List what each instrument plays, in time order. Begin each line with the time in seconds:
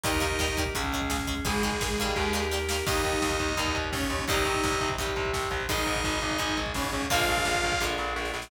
0.04 electric bass (finger) D#2, acoustic guitar (steel) D#3 G3 A#3, lead 2 (sawtooth) D#4 D#5, drawbar organ D#4 G4 A#4, kick, closed hi-hat
0.13 kick
0.20 acoustic guitar (steel) D#3 G3 A#3, kick, closed hi-hat
0.31 kick
0.39 acoustic guitar (steel) D#3 G3 A#3, kick, snare
0.48 kick
0.57 acoustic guitar (steel) D#3 G3 A#3, kick, closed hi-hat
0.66 kick
0.75 electric bass (finger) C#2, acoustic guitar (steel) C#3 G#3, drawbar organ C#4 G#4, kick, closed hi-hat
0.84 kick
0.92 acoustic guitar (steel) C#3 G#3, kick, closed hi-hat
1.01 kick
1.10 acoustic guitar (steel) C#3 G#3, kick, snare
1.19 kick
1.27 acoustic guitar (steel) C#3 G#3, kick, closed hi-hat
1.37 kick
1.45 electric bass (finger) G#1, acoustic guitar (steel) D#3 G#3, lead 2 (sawtooth) G#3 G#4, drawbar organ D#4 G#4, kick, closed hi-hat
1.54 kick
1.63 acoustic guitar (steel) D#3 G#3, kick, closed hi-hat
1.72 kick
1.81 acoustic guitar (steel) D#3 G#3, kick, snare
1.90 kick
1.98 acoustic guitar (steel) D#3 G3 A#3, kick, closed hi-hat
2.07 kick
2.16 electric bass (finger) D#2, drawbar organ D#4 G4 A#4, kick, snare
2.33 acoustic guitar (steel) D#3 G3 A#3, snare
2.51 acoustic guitar (steel) D#3 G3 A#3, snare
2.69 acoustic guitar (steel) D#3 G3 A#3, snare
2.86 electric bass (finger) D#2, acoustic guitar (steel) D#3 G3 A#3, drawbar organ A#3 D#4 G4, lead 2 (sawtooth) D#4 D#5, kick, crash
3.04 electric bass (finger) D#2, kick, closed hi-hat
3.13 kick
3.22 electric bass (finger) D#2, kick, snare
3.31 kick
3.39 electric bass (finger) D#2, kick, closed hi-hat
3.48 kick
3.57 electric bass (finger) D#2, acoustic guitar (steel) D#3 G3 A#3, drawbar organ A#3 D#4 G4, kick, closed hi-hat
3.66 kick
3.75 electric bass (finger) D#2, kick, closed hi-hat
3.84 kick
3.92 electric bass (finger) D#2, lead 2 (sawtooth) C#4 C#5, kick, snare
4.02 kick
4.10 electric bass (finger) D#2, kick, closed hi-hat
4.19 kick
4.28 electric bass (finger) C2, acoustic guitar (steel) D#3 G3 C4, drawbar organ C4 D#4 G4, lead 2 (sawtooth) D#4 D#5, kick, closed hi-hat
4.37 kick
4.45 electric bass (finger) C2, kick, closed hi-hat
4.54 kick
4.64 electric bass (finger) C2, kick, snare
4.72 kick
4.80 electric bass (finger) C2, kick, closed hi-hat
4.89 kick
4.98 electric bass (finger) C2, acoustic guitar (steel) D#3 G3 C4, drawbar organ C4 D#4 G4, kick, closed hi-hat
5.07 kick
5.16 electric bass (finger) C2, kick, closed hi-hat
5.25 kick
5.33 electric bass (finger) C2, kick, snare
5.43 kick
5.51 electric bass (finger) C2, kick, closed hi-hat
5.61 kick
5.69 electric bass (finger) G#1, acoustic guitar (steel) D#3 G#3, lead 2 (sawtooth) D#4 D#5, drawbar organ D#4 G#4, kick, closed hi-hat
5.78 kick
5.86 electric bass (finger) G#1, kick, closed hi-hat
5.96 kick
6.04 electric bass (finger) G#1, kick, snare
6.13 kick
6.22 electric bass (finger) G#1, kick, closed hi-hat
6.31 kick
6.38 electric bass (finger) G#1, acoustic guitar (steel) D#3 G#3, drawbar organ D#4 G#4, kick, closed hi-hat
6.49 kick
6.57 electric bass (finger) G#1, kick, closed hi-hat
6.66 kick
6.74 electric bass (finger) G#1, lead 2 (sawtooth) C#4 C#5, kick, snare
6.84 kick
6.92 electric bass (finger) G#1, kick, closed hi-hat
7.02 kick
7.10 electric bass (finger) A#1, acoustic guitar (steel) D3 F3 G#3 A#3, drawbar organ D4 F4 G#4 A#4, lead 2 (sawtooth) F4 F5, kick, closed hi-hat
7.19 kick
7.28 electric bass (finger) A#1, kick, closed hi-hat
7.37 kick
7.45 electric bass (finger) A#1, kick, snare
7.55 kick
7.62 electric bass (finger) A#1, kick, closed hi-hat
7.72 kick
7.80 electric bass (finger) A#1, acoustic guitar (steel) D3 F3 G#3 A#3, drawbar organ D4 F4 G#4 A#4, kick, snare
7.98 electric bass (finger) A#1, snare
8.16 electric bass (finger) A#1, snare
8.25 snare
8.34 electric bass (finger) A#1, snare
8.42 snare